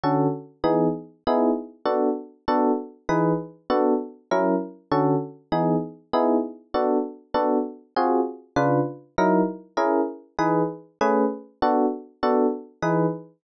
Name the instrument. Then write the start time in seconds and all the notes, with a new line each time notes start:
electric piano 1
0.03 D3 C#4 F#4 A4
0.64 E3 B3 D#4 G#4
1.27 B3 D#4 E4 G#4
1.85 B3 D4 F#4 A4
2.48 B3 D4 F#4 A4
3.09 E3 D#4 G#4 B4
3.70 B3 D4 F#4 A4
4.31 F#3 C#4 E4 A#4
4.91 D3 C#4 F#4 A4
5.52 E3 B3 D#4 G#4
6.13 B3 D#4 E4 G#4
6.74 B3 D4 F#4 A4
7.34 B3 D4 F#4 A4
7.96 C4 F4 F#4 G#4
8.56 C#3 D4 F4 B4
9.18 F#3 D#4 E4 A#4
9.77 C#4 E4 G#4 A#4
10.39 E3 D#4 G#4 B4
11.01 A3 C#4 G#4 B4
11.62 B3 D4 F#4 A4
12.23 B3 D4 F#4 A4
12.82 E3 D#4 G#4 B4